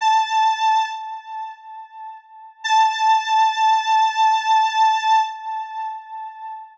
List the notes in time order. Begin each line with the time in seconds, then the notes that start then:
0.01 A5
2.64 A5